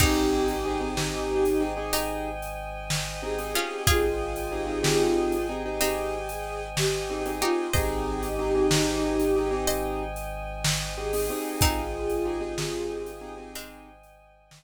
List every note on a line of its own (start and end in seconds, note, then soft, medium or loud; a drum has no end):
0.00 3.55 G#1 medium
0.00 1.67 C4 medium
0.00 0.52 C4 medium
0.00 1.67 D#4 loud
0.00 0.52 D#4 medium
0.00 1.63 D#4 loud
0.00 0.52 G4 medium
0.00 1.63 G4 loud
0.00 0.52 G#4 medium
0.00 7.66 C5 medium
0.00 7.66 D#5 medium
0.00 7.66 G5 medium
0.00 7.66 G#5 medium
0.00 kick loud
0.00 crash loud
0.48 closed hi-hat medium
0.65 0.78 C4 medium
0.65 0.78 D#4 medium
0.65 0.78 G4 medium
0.65 0.78 G#4 medium
0.81 0.93 C4 medium
0.81 0.93 D#4 medium
0.81 0.93 G4 medium
0.81 0.93 G#4 medium
0.97 1.49 C4 medium
0.97 1.49 D#4 medium
0.97 1.49 G4 medium
0.97 1.49 G#4 medium
0.97 snare loud
1.45 closed hi-hat medium
1.60 1.73 C4 medium
1.60 1.73 D#4 medium
1.60 1.73 G4 medium
1.60 1.73 G#4 medium
1.77 2.28 C4 medium
1.77 2.28 D#4 medium
1.77 2.28 G4 medium
1.77 2.28 G#4 medium
1.93 3.46 D#4 medium
1.93 3.46 G4 medium
1.93 closed hi-hat loud
2.42 closed hi-hat medium
2.90 snare loud
3.22 3.35 C4 medium
3.22 3.35 D#4 medium
3.22 3.35 G4 medium
3.22 3.35 G#4 medium
3.22 3.82 G#4 loud
3.38 3.52 C4 medium
3.38 3.52 D#4 medium
3.38 3.52 G4 medium
3.38 3.52 G#4 medium
3.38 closed hi-hat medium
3.54 4.06 C4 medium
3.54 3.83 C#4 medium
3.54 4.06 D#4 medium
3.54 3.83 F4 medium
3.54 4.06 G4 medium
3.54 4.06 G#4 medium
3.86 7.43 G#1 medium
3.86 5.45 F4 loud
3.86 5.75 F4 loud
3.86 5.45 G#4 loud
3.86 5.75 G#4 loud
3.86 kick loud
3.86 closed hi-hat loud
4.36 closed hi-hat medium
4.51 4.64 C4 medium
4.51 4.64 D#4 medium
4.51 4.64 G4 medium
4.51 4.64 G#4 medium
4.67 4.80 C4 medium
4.67 4.80 D#4 medium
4.67 4.80 G4 medium
4.67 4.80 G#4 medium
4.83 5.34 C4 medium
4.83 5.34 D#4 medium
4.83 5.34 G4 medium
4.83 5.34 G#4 medium
4.83 snare loud
5.32 closed hi-hat medium
5.49 5.62 C4 medium
5.49 5.62 D#4 medium
5.49 5.62 G4 medium
5.49 5.62 G#4 medium
5.66 6.17 C4 medium
5.66 6.17 D#4 medium
5.66 6.17 G4 medium
5.66 6.17 G#4 medium
5.80 7.33 C4 medium
5.80 7.33 D#4 medium
5.80 5.95 G4 loud
5.80 closed hi-hat loud
5.97 6.13 G4 loud
6.13 6.28 G4 medium
6.28 6.43 G#4 medium
6.28 closed hi-hat medium
6.44 6.60 G#4 medium
6.77 7.31 G4 medium
6.77 snare loud
7.10 7.23 C4 medium
7.10 7.23 D#4 medium
7.10 7.23 G4 medium
7.10 7.23 G#4 medium
7.26 7.39 C4 medium
7.26 7.39 D#4 medium
7.26 7.39 G4 medium
7.26 7.39 G#4 medium
7.26 closed hi-hat medium
7.41 7.67 C4 medium
7.41 7.67 D#4 medium
7.41 7.72 D#4 medium
7.41 7.72 F4 medium
7.41 7.67 G4 medium
7.41 7.72 G4 medium
7.41 7.67 G#4 medium
7.73 11.30 G#1 medium
7.73 8.26 C4 medium
7.73 8.26 D#4 medium
7.73 9.54 D#4 loud
7.73 8.26 G4 medium
7.73 9.54 G4 loud
7.73 8.26 G#4 medium
7.73 9.58 C5 medium
7.73 14.64 C5 medium
7.73 9.58 D#5 medium
7.73 14.64 D#5 medium
7.73 14.64 G5 medium
7.73 14.64 G#5 medium
7.73 kick loud
7.73 closed hi-hat loud
8.23 closed hi-hat medium
8.39 8.52 C4 medium
8.39 8.52 D#4 medium
8.39 8.52 G4 medium
8.39 8.52 G#4 medium
8.55 8.68 C4 medium
8.55 8.68 D#4 medium
8.55 8.68 G4 medium
8.55 8.68 G#4 medium
8.71 9.23 C4 medium
8.71 9.23 D#4 medium
8.71 9.23 G4 medium
8.71 9.23 G#4 medium
8.71 snare loud
9.20 closed hi-hat medium
9.36 9.49 C4 medium
9.36 9.49 D#4 medium
9.36 9.49 G4 medium
9.36 9.49 G#4 medium
9.51 10.03 C4 medium
9.51 10.03 D#4 medium
9.51 10.03 G4 medium
9.51 10.03 G#4 medium
9.67 11.12 C5 medium
9.67 11.12 D#5 loud
9.67 closed hi-hat loud
10.16 closed hi-hat medium
10.64 snare loud
10.97 11.10 C4 medium
10.97 11.10 D#4 medium
10.97 11.10 G4 medium
10.97 11.60 G#4 medium
10.97 11.10 G#4 medium
11.13 11.26 C4 medium
11.13 11.26 D#4 medium
11.13 11.26 G4 medium
11.13 11.26 G#4 medium
11.13 open hi-hat medium
11.30 11.81 C4 medium
11.30 11.81 D#4 medium
11.30 11.81 G4 medium
11.30 11.81 G#4 medium
11.61 14.64 G#1 medium
11.61 13.26 C4 medium
11.61 13.26 D#4 loud
11.61 13.49 F4 medium
11.61 13.49 G#4 medium
11.61 kick loud
11.61 closed hi-hat loud
12.10 closed hi-hat medium
12.25 12.38 C4 medium
12.25 12.38 D#4 medium
12.25 12.38 G4 medium
12.25 12.38 G#4 medium
12.40 12.53 C4 medium
12.40 12.53 D#4 medium
12.40 12.53 G4 medium
12.40 12.53 G#4 medium
12.58 13.11 C4 medium
12.58 13.11 D#4 medium
12.58 13.11 G4 medium
12.58 13.11 G#4 medium
12.58 snare loud
13.06 closed hi-hat medium
13.21 13.34 C4 medium
13.21 13.34 D#4 medium
13.21 13.34 G4 medium
13.21 13.34 G#4 medium
13.37 13.89 C4 medium
13.37 13.89 D#4 medium
13.37 13.89 G4 medium
13.37 13.89 G#4 medium
13.55 14.14 G#3 medium
13.55 14.14 C4 medium
13.55 closed hi-hat loud
14.03 closed hi-hat medium
14.51 snare loud